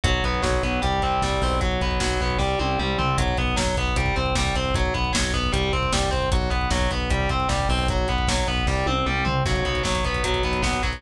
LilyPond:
<<
  \new Staff \with { instrumentName = "Overdriven Guitar" } { \time 4/4 \key b \phrygian \tempo 4 = 153 fis8 b8 fis8 b8 g8 c'8 g8 c'8 | fis8 b8 fis8 b8 g8 c'8 g8 c'8 | fis8 b8 fis8 b8 g8 c'8 g8 c'8 | fis8 b8 fis8 b8 g8 c'8 g8 c'8 |
fis8 b8 fis8 b8 g8 c'8 g8 c'8 | fis8 b8 fis8 b8 g8 c'8 g8 c'8 | fis8 b8 fis8 b8 fis8 b8 b8 fis8 | }
  \new Staff \with { instrumentName = "Synth Bass 1" } { \clef bass \time 4/4 \key b \phrygian b,,8 b,,8 b,,8 b,,8 c,8 c,8 c,8 b,,8~ | b,,8 b,,8 b,,8 b,,8 c,8 c,8 c,8 c,8 | b,,8 b,,8 b,,8 b,,8 c,8 c,8 c,8 c,8 | b,,8 b,,8 b,,8 b,,8 c,8 c,8 c,8 c,8 |
b,,8 b,,8 b,,8 b,,8 c,8 c,8 c,8 b,,8~ | b,,8 b,,8 b,,8 b,,8 c,8 c,8 c,8 c,8 | b,,8 b,,8 b,,8 b,,8 b,,8 b,,8 b,,8 b,,8 | }
  \new DrumStaff \with { instrumentName = "Drums" } \drummode { \time 4/4 <hh bd>16 bd16 <hh bd>16 bd16 <bd sn>16 bd16 <hh bd>16 bd16 <hh bd>16 bd16 <hh bd>16 bd16 <bd sn>16 bd16 <hho bd>16 bd16 | <hh bd>16 bd16 <hh bd>16 bd16 <bd sn>16 bd16 <hh bd>16 bd16 <bd sn>8 tommh8 toml8 tomfh8 | <hh bd>16 bd16 <hh bd>16 bd16 <bd sn>16 bd16 <hh bd>16 bd16 <hh bd>16 bd16 <hh bd>16 bd16 <bd sn>16 bd16 <hh bd>16 bd16 | <hh bd>16 bd16 <hh bd>16 bd16 <bd sn>16 bd16 <hh bd>16 bd16 <hh bd>16 bd16 <hh bd>16 bd16 <bd sn>16 bd16 <hh bd>16 bd16 |
<hh bd>16 bd16 <hh bd>16 bd16 <bd sn>16 bd16 <hh bd>16 bd16 <hh bd>16 bd16 <hh bd>16 bd16 <bd sn>16 bd16 <hho bd>16 bd16 | <hh bd>16 bd16 <hh bd>16 bd16 <bd sn>16 bd16 <hh bd>16 bd16 <bd sn>8 tommh8 toml8 tomfh8 | <cymc bd>16 <hh bd>16 <hh bd>16 <hh bd>16 <bd sn>16 <hh bd>16 <hh bd>16 <hh bd>16 <hh bd>16 <hh bd>16 <hh bd>16 <hh bd>16 <bd sn>16 <hh bd>16 <hh bd>16 <hh bd>16 | }
>>